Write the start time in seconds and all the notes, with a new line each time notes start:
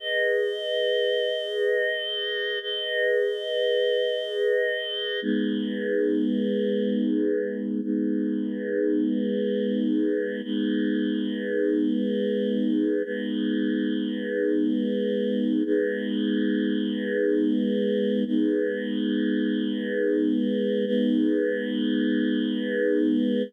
0.00 G#4 B4 D#5
2.61 G#4 B4 D#5
5.22 G#3 B3 D#4
7.82 G#3 B3 D#4
10.43 G#3 B3 D#4
13.04 G#3 B3 D#4
15.65 G#3 B3 D#4
18.26 G#3 B3 D#4
20.86 G#3 B3 D#4